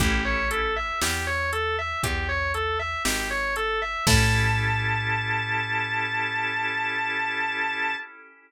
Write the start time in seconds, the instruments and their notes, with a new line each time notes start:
0.00 electric bass (finger) A1, drawbar organ C#4 E4 G4 A4, distortion guitar G4, kick, closed hi-hat
0.25 distortion guitar C#5
0.51 distortion guitar A4, closed hi-hat
0.76 distortion guitar E5
1.01 electric bass (finger) E2, distortion guitar G4, snare
1.27 distortion guitar C#5
1.53 distortion guitar A4, closed hi-hat
1.79 distortion guitar E5
2.03 electric bass (finger) E2, distortion guitar G4, kick, closed hi-hat
2.29 distortion guitar C#5
2.54 distortion guitar A4, closed hi-hat
2.79 distortion guitar E5
3.05 electric bass (finger) G#1, distortion guitar G4, snare
3.31 distortion guitar C#5
3.56 distortion guitar A4, closed hi-hat
3.82 distortion guitar E5
4.07 electric bass (finger) A2, drawbar organ C#4 E4 G4 A4, distortion guitar A5, kick, crash